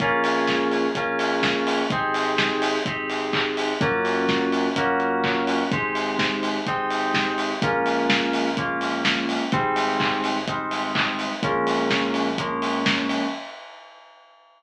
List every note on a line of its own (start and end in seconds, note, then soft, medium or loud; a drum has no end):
0.00 0.87 A#1 loud
0.00 0.86 A#3 loud
0.00 0.86 C#4 loud
0.00 0.86 F4 loud
0.00 0.86 G#4 loud
0.00 kick loud
0.00 closed hi-hat loud
0.24 open hi-hat medium
0.48 kick medium
0.48 snare loud
0.71 open hi-hat medium
0.95 1.83 A#1 medium
0.95 1.81 A#3 medium
0.95 1.81 C#4 loud
0.95 1.81 F4 medium
0.95 1.81 G#4 loud
0.95 kick medium
0.95 closed hi-hat loud
1.19 open hi-hat medium
1.43 kick loud
1.43 snare loud
1.67 open hi-hat medium
1.90 2.78 G#1 loud
1.90 2.76 C4 loud
1.90 2.76 D#4 loud
1.90 2.76 G4 loud
1.90 2.76 G#4 loud
1.90 kick loud
1.90 closed hi-hat loud
2.14 open hi-hat medium
2.38 kick loud
2.38 snare loud
2.62 open hi-hat loud
2.86 3.74 G#1 medium
2.86 3.72 C4 loud
2.86 3.72 D#4 medium
2.86 3.72 G4 loud
2.86 3.72 G#4 medium
2.86 kick loud
2.86 closed hi-hat loud
3.10 open hi-hat medium
3.33 kick medium
3.33 clap loud
3.57 open hi-hat medium
3.81 4.69 F#2 medium
3.81 4.66 A#3 loud
3.81 4.66 C#4 loud
3.81 4.66 F4 loud
3.81 4.66 F#4 loud
3.81 kick loud
3.81 closed hi-hat loud
4.05 open hi-hat medium
4.29 kick loud
4.29 snare loud
4.52 open hi-hat medium
4.76 5.63 F#2 medium
4.76 5.62 A#3 loud
4.76 5.62 C#4 loud
4.76 5.62 F4 loud
4.76 5.62 F#4 loud
4.76 kick loud
4.76 closed hi-hat loud
5.00 closed hi-hat medium
5.24 kick loud
5.24 clap loud
5.47 open hi-hat medium
5.71 6.59 G#1 medium
5.71 6.58 G#3 loud
5.71 6.58 C4 loud
5.71 6.58 D#4 loud
5.71 6.58 G4 loud
5.71 kick loud
5.71 closed hi-hat loud
5.95 open hi-hat medium
6.19 kick medium
6.19 snare loud
6.43 open hi-hat medium
6.66 7.54 G#1 medium
6.66 7.52 G#3 medium
6.66 7.52 C4 loud
6.66 7.52 D#4 loud
6.66 7.52 G4 loud
6.66 kick loud
6.66 closed hi-hat loud
6.90 open hi-hat medium
7.14 kick medium
7.14 snare loud
7.38 open hi-hat medium
7.62 9.37 A#1 loud
7.62 8.48 G#3 loud
7.62 8.48 A#3 loud
7.62 8.48 C#4 loud
7.62 8.48 F4 loud
7.62 kick loud
7.62 closed hi-hat loud
7.86 open hi-hat medium
8.10 kick loud
8.10 snare loud
8.33 open hi-hat loud
8.57 9.43 G#3 medium
8.57 9.43 A#3 loud
8.57 9.43 C#4 loud
8.57 9.43 F4 medium
8.57 kick loud
8.57 closed hi-hat loud
8.81 open hi-hat medium
9.05 kick medium
9.05 snare loud
9.29 open hi-hat medium
9.52 11.28 G#1 loud
9.52 10.38 G3 loud
9.52 10.38 G#3 loud
9.52 10.38 C4 loud
9.52 10.38 D#4 loud
9.52 kick loud
9.52 closed hi-hat loud
9.76 open hi-hat medium
10.00 kick loud
10.00 clap loud
10.24 open hi-hat medium
10.48 11.33 G3 loud
10.48 11.33 G#3 medium
10.48 11.33 C4 loud
10.48 11.33 D#4 medium
10.48 kick loud
10.48 closed hi-hat loud
10.71 open hi-hat medium
10.95 kick loud
10.95 clap loud
11.19 open hi-hat medium
11.43 13.19 A#1 loud
11.43 12.29 F3 loud
11.43 12.29 G#3 loud
11.43 12.29 A#3 loud
11.43 12.29 C#4 loud
11.43 kick loud
11.43 closed hi-hat loud
11.67 open hi-hat medium
11.90 kick medium
11.90 snare loud
12.14 open hi-hat medium
12.38 13.24 F3 loud
12.38 13.24 G#3 loud
12.38 13.24 A#3 loud
12.38 13.24 C#4 loud
12.38 kick medium
12.38 closed hi-hat loud
12.62 open hi-hat medium
12.86 kick loud
12.86 snare loud
13.09 open hi-hat medium